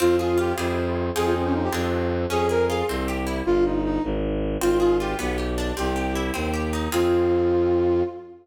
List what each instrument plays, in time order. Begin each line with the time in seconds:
0.00 violin F2, orchestral harp C4, flute F4
0.19 flute F4, orchestral harp G#4
0.38 orchestral harp F4, flute G4
0.58 violin F2, orchestral harp C4 E4 F4 G#4
1.15 violin F2, orchestral harp C4 D#4 F4 G#4, flute G#4
1.25 flute F4
1.34 flute C4
1.45 flute C#4
1.54 flute D#4
1.64 flute G4
1.73 violin F2, orchestral harp C4 D4 F4 G#4
2.30 violin F2, orchestral harp C#4, flute G#4
2.49 orchestral harp G#4, flute A#4
2.69 orchestral harp F4, flute G#4
2.89 violin C2, orchestral harp C4
3.08 orchestral harp G4
3.27 orchestral harp E4
3.46 violin G1, flute F4
3.65 flute D#4
3.84 flute D#4
4.04 violin G#1
4.61 violin G#1, orchestral harp C4, flute F4
4.80 flute F4, orchestral harp G#4
5.00 orchestral harp F4, flute G4
5.19 violin B1, orchestral harp B3
5.38 orchestral harp G4
5.58 orchestral harp D4
5.76 violin C2, orchestral harp C4, flute G4
5.96 orchestral harp G4
6.15 orchestral harp E4
6.34 violin D#2, orchestral harp C4
6.54 orchestral harp G4
6.73 orchestral harp D#4
6.92 violin F2, orchestral harp C4 F4 G#4, flute F4